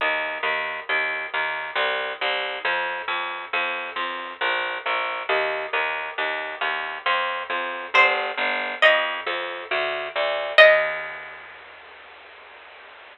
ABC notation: X:1
M:3/4
L:1/8
Q:1/4=68
K:Eb
V:1 name="Harpsichord"
z6 | z6 | z6 | c2 e4 |
e6 |]
V:2 name="Electric Bass (finger)" clef=bass
E,, E,, E,, E,, C,, C,, | F,, F,, F,, F,, B,,, B,,, | E,, E,, E,, E,, F,, F,, | G,,, G,,, F,, F,, D,, D,, |
E,,6 |]